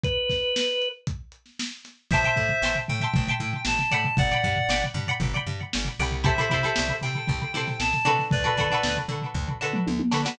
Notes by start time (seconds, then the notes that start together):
0.03 B4, kick, closed hi-hat
0.30 kick, snare, closed hi-hat
0.56 snare
0.82 closed hi-hat
1.07 kick, closed hi-hat
1.32 closed hi-hat
1.46 snare
1.59 snare
1.72 snare
1.85 snare, closed hi-hat
2.11 A1 C5 E5 G5 A5, kick, floor tom
2.15 C6
2.24 E5 G5 A5 C6, floor tom
2.36 A2, kick, floor tom
2.49 floor tom
2.62 A1 E5 G5 A5 C6, snare
2.75 floor tom
2.88 A2 G5, floor tom
3.00 E5 G5 A5, floor tom
3.04 C6
3.14 A1, kick, floor tom
3.27 E5 G5 A5 C6, floor tom
3.40 A2, floor tom
3.53 floor tom
3.65 A1 A5, snare
3.78 snare, floor tom
3.91 A2 D5 F#5 G5 B5, floor tom
4.04 floor tom
4.17 G1 D5 F#5, kick, floor tom
4.31 D5 F#5 G5 B5, snare, floor tom
4.43 G2, kick, snare, floor tom
4.56 floor tom
4.69 G1 D5 F#5 G5 B5, snare
4.82 snare, floor tom
4.94 G2, floor tom
5.07 D5 F#5 G5 B5, floor tom
5.20 G1, kick, floor tom
5.34 D5 F#5 G5 B5, floor tom
5.47 G2, floor tom
5.61 floor tom
5.73 G1, snare
5.85 snare, floor tom
5.99 C2 D5 F#5 G5 B5, floor tom
6.11 floor tom
6.24 E4 G4 A4 C5 E5, kick, floor tom
6.38 E4 G4 A4 C5, floor tom
6.50 C3 E4 G4 A4, kick, floor tom
6.54 C5
6.63 E4 G4 A4 C5, floor tom
6.76 C2, snare
6.88 floor tom
7.01 C3 G5, snare, floor tom
7.15 floor tom
7.27 C2, kick, floor tom
7.41 floor tom
7.54 C3 E4 G4 A4 C5, floor tom
7.67 snare, floor tom
7.80 C2 A5, snare
7.93 snare, floor tom
8.05 C3 D4 F#4 A4 B4, floor tom
8.19 snare, floor tom
8.31 D2 B4 D5, kick, floor tom
8.44 D4 F#4 A4 B4, floor tom
8.57 D3 D4 F#4 A4 B4, kick, snare, floor tom
8.70 D4 F#4 A4 B4, floor tom
8.83 D2, snare
8.97 floor tom
9.08 D3, floor tom
9.22 floor tom
9.34 D2, kick
9.48 floor tom
9.61 D3 D4 F#4 A4 B4
9.73 mid tom
9.87 D2, high tom
9.99 high tom
10.11 D3 D4 F#4 A4 B4, snare
10.25 D4 F#4 A4 B4, snare